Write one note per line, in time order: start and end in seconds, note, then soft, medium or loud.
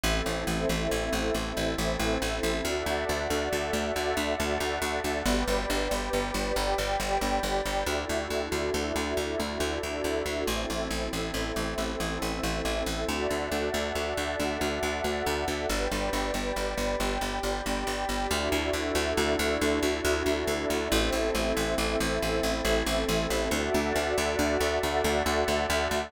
0.03 0.22 A1 medium
0.03 2.63 C4 medium
0.03 2.63 E4 medium
0.03 2.62 A4 medium
0.03 2.63 A4 medium
0.03 2.62 C5 medium
0.03 2.62 E5 medium
0.26 0.44 A1 medium
0.47 0.65 A1 medium
0.69 0.88 A1 medium
0.91 1.10 A1 medium
1.13 1.31 A1 medium
1.34 1.53 A1 medium
1.57 1.75 A1 medium
1.78 1.97 A1 medium
1.99 2.18 A1 medium
2.22 2.40 A1 medium
2.43 2.62 A1 medium
2.64 2.83 D2 medium
2.64 3.94 F#4 medium
2.64 3.94 A4 medium
2.64 3.94 D5 medium
2.64 5.23 D5 medium
2.64 3.94 E5 medium
2.64 5.23 E5 medium
2.64 5.23 F#5 medium
2.64 5.23 A5 medium
2.86 3.05 D2 medium
3.09 3.28 D2 medium
3.30 3.49 D2 medium
3.53 3.71 D2 medium
3.73 3.92 D2 medium
3.96 4.14 D2 medium
3.96 5.25 F#4 medium
3.96 5.25 A4 medium
3.96 5.25 E5 medium
3.96 5.25 F#5 medium
4.17 4.35 D2 medium
4.40 4.58 D2 medium
4.60 4.79 D2 medium
4.82 5.00 D2 medium
5.04 5.23 D2 medium
5.25 5.44 G1 medium
5.25 6.55 G4 medium
5.25 6.56 B4 loud
5.25 7.85 D5 medium
5.25 6.55 D5 medium
5.25 7.85 G5 medium
5.25 7.85 B5 medium
5.47 5.66 G1 medium
5.70 5.88 G1 medium
5.91 6.10 G1 medium
6.13 6.32 G1 medium
6.34 6.53 G1 medium
6.56 6.75 G1 medium
6.56 7.85 G4 medium
6.56 7.85 D5 medium
6.56 7.85 G5 medium
6.78 6.97 G1 medium
7.00 7.18 G1 medium
7.21 7.40 G1 medium
7.43 7.62 G1 medium
7.65 7.84 G1 medium
7.86 8.05 D2 medium
7.86 10.45 D4 medium
7.86 10.45 E4 medium
7.86 10.45 F#4 medium
7.86 10.46 F#4 medium
7.86 10.45 A4 medium
7.86 10.46 A4 medium
7.86 10.46 D5 medium
7.86 10.46 E5 medium
8.09 8.28 D2 medium
8.30 8.49 D2 medium
8.52 8.70 D2 medium
8.74 8.92 D2 medium
8.96 9.14 D2 medium
9.17 9.36 D2 medium
9.39 9.58 D2 medium
9.60 9.79 D2 medium
9.83 10.02 D2 medium
10.04 10.23 D2 medium
10.26 10.44 D2 medium
10.47 10.66 A1 medium
10.47 13.06 C4 medium
10.47 13.06 E4 medium
10.47 13.06 A4 medium
10.47 13.07 A4 medium
10.47 13.07 C5 medium
10.47 13.07 E5 medium
10.70 10.88 A1 medium
10.90 11.09 A1 medium
11.13 11.31 A1 medium
11.34 11.52 A1 medium
11.56 11.75 A1 medium
11.78 11.96 A1 medium
12.00 12.18 A1 medium
12.22 12.40 A1 medium
12.43 12.62 A1 medium
12.65 12.83 A1 medium
12.86 13.05 A1 medium
13.08 13.27 D2 medium
13.08 14.37 F#4 medium
13.08 14.37 A4 medium
13.08 14.37 D5 medium
13.08 15.67 D5 medium
13.08 14.37 E5 medium
13.08 15.67 E5 medium
13.08 15.67 F#5 medium
13.08 15.67 A5 medium
13.30 13.49 D2 medium
13.52 13.70 D2 medium
13.74 13.92 D2 medium
13.95 14.14 D2 medium
14.17 14.36 D2 medium
14.38 14.58 D2 medium
14.38 15.68 F#4 medium
14.38 15.68 A4 medium
14.38 15.68 E5 medium
14.38 15.68 F#5 medium
14.61 14.79 D2 medium
14.83 15.01 D2 medium
15.04 15.23 D2 medium
15.26 15.45 D2 medium
15.48 15.66 D2 medium
15.69 15.88 G1 medium
15.69 16.99 G4 medium
15.69 16.99 B4 medium
15.69 18.28 D5 medium
15.69 16.99 D5 medium
15.69 18.28 G5 medium
15.69 18.28 B5 medium
15.91 16.10 G1 medium
16.13 16.31 G1 medium
16.34 16.52 G1 medium
16.56 16.75 G1 medium
16.77 16.96 G1 medium
17.00 17.18 G1 medium
17.00 18.30 G4 medium
17.00 18.30 D5 medium
17.00 18.30 G5 medium
17.21 17.40 G1 medium
17.43 17.62 G1 medium
17.66 17.84 G1 medium
17.87 18.05 G1 medium
18.09 18.27 G1 medium
18.30 18.49 D2 medium
18.30 20.89 D4 medium
18.30 20.89 E4 medium
18.30 20.89 F#4 medium
18.30 20.89 A4 medium
18.30 20.89 D5 medium
18.30 20.89 E5 loud
18.52 18.70 D2 medium
18.73 18.92 D2 medium
18.95 19.13 D2 medium
19.17 19.36 D2 medium
19.39 19.58 D2 medium
19.61 19.80 D2 medium
19.83 20.01 D2 medium
20.05 20.23 D2 medium
20.26 20.44 D2 medium
20.47 20.66 D2 medium
20.70 20.88 D2 medium
20.91 21.10 A1 medium
20.91 23.50 C4 medium
20.91 23.50 E4 medium
20.91 23.49 A4 loud
20.91 23.50 A4 medium
20.91 23.49 C5 medium
20.91 23.49 E5 medium
21.12 21.31 A1 medium
21.35 21.53 A1 medium
21.57 21.75 A1 medium
21.78 21.96 A1 medium
22.00 22.19 A1 medium
22.22 22.41 A1 medium
22.43 22.62 A1 medium
22.65 22.83 A1 medium
22.86 23.05 A1 medium
23.09 23.27 A1 medium
23.30 23.49 A1 medium
23.51 23.70 D2 medium
23.51 24.81 F#4 medium
23.51 24.81 A4 medium
23.51 24.81 D5 medium
23.51 26.11 D5 medium
23.51 24.81 E5 medium
23.51 26.11 E5 medium
23.51 26.11 F#5 medium
23.51 26.11 A5 medium
23.74 23.93 D2 medium
23.95 24.14 D2 medium
24.18 24.36 D2 medium
24.39 24.57 D2 medium
24.60 24.79 D2 medium
24.83 25.02 D2 medium
24.83 26.12 F#4 medium
24.83 26.12 A4 medium
24.83 26.12 E5 loud
24.83 26.12 F#5 medium
25.04 25.23 D2 medium
25.26 25.44 D2 medium
25.48 25.66 D2 medium
25.70 25.88 D2 medium
25.91 26.09 D2 medium